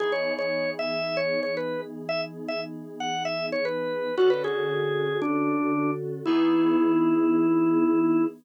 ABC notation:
X:1
M:4/4
L:1/16
Q:1/4=115
K:Emix
V:1 name="Drawbar Organ"
G c2 c3 e3 c2 c B2 z2 | e z2 e z3 f2 e2 c B4 | F B G6 D6 z2 | E16 |]
V:2 name="Electric Piano 2"
[E,B,^DG]16- | [E,B,^DG]16 | [D,CFA]16 | [E,B,^DG]16 |]